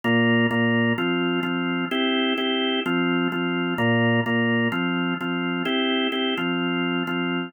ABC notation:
X:1
M:4/4
L:1/8
Q:1/4=128
K:Cmix
V:1 name="Drawbar Organ"
[B,,B,F]2 [B,,B,F]2 [F,CF]2 [F,CF]2 | [CEG]2 [CEG]2 [F,CF]2 [F,CF]2 | [B,,B,F]2 [B,,B,F]2 [F,CF]2 [F,CF]2 | [CEG]2 [CEG] [F,CF]3 [F,CF]2 |]